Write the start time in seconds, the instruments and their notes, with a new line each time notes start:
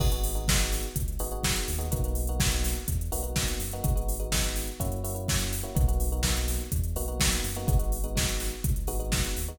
0.00 synth bass 2 G#1, electric piano 1 B3 D#4 F#4 G#4, kick, crash
0.12 electric piano 1 B3 D#4 F#4 G#4, closed hi-hat
0.24 open hi-hat
0.35 electric piano 1 B3 D#4 F#4 G#4, closed hi-hat
0.48 electric piano 1 B3 D#4 F#4 G#4, kick, snare
0.60 closed hi-hat
0.72 snare, open hi-hat
0.83 closed hi-hat
0.96 synth bass 2 C#2, kick, closed hi-hat
1.08 closed hi-hat
1.19 synth bass 2 G#1, electric piano 1 B3 D#4 F#4 G#4, open hi-hat
1.31 electric piano 1 B3 D#4 F#4 G#4, closed hi-hat
1.43 kick, snare
1.56 closed hi-hat
1.68 synth bass 2 D#2, open hi-hat
1.79 electric piano 1 B3 D#4 F#4 G#4, closed hi-hat
1.91 synth bass 2 B1, electric piano 1 A#3 B3 D#4 F#4, kick, closed hi-hat
2.04 electric piano 1 A#3 B3 D#4 F#4, closed hi-hat
2.15 open hi-hat
2.27 electric piano 1 A#3 B3 D#4 F#4, closed hi-hat
2.39 electric piano 1 A#3 B3 D#4 F#4, kick, snare
2.51 closed hi-hat
2.64 snare, open hi-hat
2.75 closed hi-hat
2.88 synth bass 2 E2, kick, closed hi-hat
3.01 closed hi-hat
3.12 synth bass 2 B1, electric piano 1 A#3 B3 D#4 F#4, open hi-hat
3.23 electric piano 1 A#3 B3 D#4 F#4, closed hi-hat
3.36 kick, snare
3.48 closed hi-hat
3.60 synth bass 2 F#2, open hi-hat
3.71 electric piano 1 A#3 B3 D#4 F#4, closed hi-hat
3.83 synth bass 2 G#1, electric piano 1 G#3 B3 D#4 F#4, kick, closed hi-hat
3.96 electric piano 1 G#3 B3 D#4 F#4, closed hi-hat
4.08 open hi-hat
4.20 electric piano 1 G#3 B3 D#4 F#4, closed hi-hat
4.32 electric piano 1 G#3 B3 D#4 F#4, kick, snare
4.44 closed hi-hat
4.56 snare, open hi-hat
4.67 closed hi-hat
4.80 synth bass 2 F#2, electric piano 1 A#3 C#4 E4 F#4, kick, closed hi-hat
4.92 closed hi-hat
5.04 electric piano 1 A#3 C#4 E4 F#4, open hi-hat
5.15 electric piano 1 A#3 C#4 E4 F#4, closed hi-hat
5.28 kick, snare
5.39 closed hi-hat
5.53 open hi-hat
5.63 electric piano 1 A#3 C#4 E4 F#4, closed hi-hat
5.75 synth bass 2 B1, electric piano 1 A#3 B3 D#4 F#4, kick, closed hi-hat
5.88 electric piano 1 A#3 B3 D#4 F#4, closed hi-hat
6.00 open hi-hat
6.12 electric piano 1 A#3 B3 D#4 F#4, closed hi-hat
6.23 electric piano 1 A#3 B3 D#4 F#4, kick, snare
6.37 closed hi-hat
6.48 snare, open hi-hat
6.61 closed hi-hat
6.72 synth bass 2 E2, kick, closed hi-hat
6.84 closed hi-hat
6.96 synth bass 2 B1, electric piano 1 A#3 B3 D#4 F#4, open hi-hat
7.08 electric piano 1 A#3 B3 D#4 F#4, closed hi-hat
7.20 kick, snare
7.32 closed hi-hat
7.44 synth bass 2 F#2, open hi-hat
7.55 electric piano 1 A#3 B3 D#4 F#4, closed hi-hat
7.67 synth bass 2 G#1, electric piano 1 G#3 B3 D#4 F#4, kick, closed hi-hat
7.79 electric piano 1 G#3 B3 D#4 F#4, closed hi-hat
7.92 open hi-hat
8.04 electric piano 1 G#3 B3 D#4 F#4, closed hi-hat
8.15 electric piano 1 G#3 B3 D#4 F#4, kick, snare
8.29 closed hi-hat
8.40 snare, open hi-hat
8.51 closed hi-hat
8.64 synth bass 2 C#2, kick, closed hi-hat
8.76 closed hi-hat
8.87 synth bass 2 G#1, electric piano 1 G#3 B3 D#4 F#4, open hi-hat
9.00 electric piano 1 G#3 B3 D#4 F#4, closed hi-hat
9.12 kick, snare
9.24 closed hi-hat
9.36 synth bass 2 D#2, open hi-hat
9.48 electric piano 1 G#3 B3 D#4 F#4, closed hi-hat